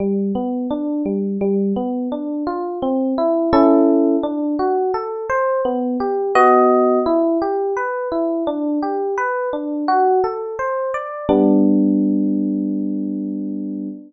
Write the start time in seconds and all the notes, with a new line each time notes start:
0.00 G3
0.35 B3
0.71 D4
1.06 G3
1.41 G3
1.76 B3
2.12 D4
2.47 F4
2.82 C4
3.18 E4
3.53 C#4 E4 A4
4.23 D4
4.59 F#4
4.94 A4
5.30 C5
5.65 B3
6.00 G4
6.35 B3 F#4 D#5
7.06 E4
7.42 G4
7.77 B4
8.12 E4
8.47 D4
8.82 G4
9.18 B4
9.53 D4
9.88 F#4
10.24 A4
10.59 C5
10.94 D5
11.29 G3 B3 D4